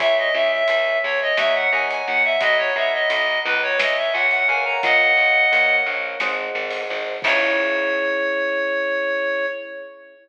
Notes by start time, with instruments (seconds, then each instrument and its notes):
0.00 electric bass (finger) C#2, electric piano 1 C#5 E5 G#5, clarinet E5, kick, closed hi-hat
0.18 clarinet D#5
0.34 electric bass (finger) C#2, electric piano 1 C#5 E5 G#5, clarinet E5
0.52 clarinet E5
0.68 electric bass (finger) C#2, clarinet E5, closed hi-hat
1.03 electric bass (finger) C#2, clarinet C#5
1.21 clarinet D#5
1.37 electric bass (finger) D#2, electric piano 1 C#5 D#5 F#5 A#5, clarinet E5, snare
1.55 clarinet F#5
1.72 electric bass (finger) D#2, electric piano 1 C#5 D#5 F#5 A#5, clarinet G#5
1.90 clarinet G#5, closed hi-hat
2.07 electric bass (finger) D#2, clarinet F#5
2.24 clarinet E5
2.41 electric bass (finger) B1, electric piano 1 D#5 F#5 A#5 B5, clarinet D#5, kick, closed hi-hat
2.58 clarinet C#5
2.76 electric bass (finger) B1, electric piano 1 D#5 F#5 A#5 B5, clarinet E5
2.93 clarinet D#5
3.10 electric bass (finger) B1, clarinet D#5, closed hi-hat
3.45 electric bass (finger) C#2, clarinet B4
3.62 clarinet C#5
3.79 electric piano 1 C#5 E5 G#5, clarinet D#5, snare
3.97 clarinet E5
4.13 electric bass (finger) C#2, electric piano 1 C#5 E5 G#5, clarinet F#5
4.31 clarinet F#5, closed hi-hat
4.48 electric bass (finger) C#2, electric piano 1 A#4 C#5 F5 F#5, clarinet G#5
4.65 clarinet A#5
4.83 electric bass (finger) A#1, clarinet D#5 F#5, kick, closed hi-hat
5.17 electric bass (finger) A#1
5.52 electric bass (finger) A#1, electric piano 1 A#4 C#5 F5 F#5, closed hi-hat
5.86 electric bass (finger) A#1, electric piano 1 A#4 C#5 F5 F#5
6.20 electric bass (finger) G#1, electric piano 1 G#4 C5 D#5 F#5, snare
6.55 electric bass (finger) G#1
6.71 open hi-hat
6.90 electric bass (finger) G#1
7.22 electric bass (finger) C#2, electric piano 1 C#4 E4 G#4, clarinet C#5, kick, crash